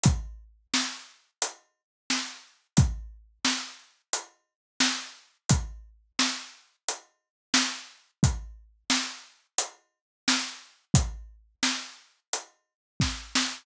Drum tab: HH |x---x---|x---x---|x---x---|x---x---|
SD |--o---o-|--o---o-|--o---o-|--o---o-|
BD |o-------|o-------|o-------|o-------|

HH |x---x---|
SD |--o---oo|
BD |o-----o-|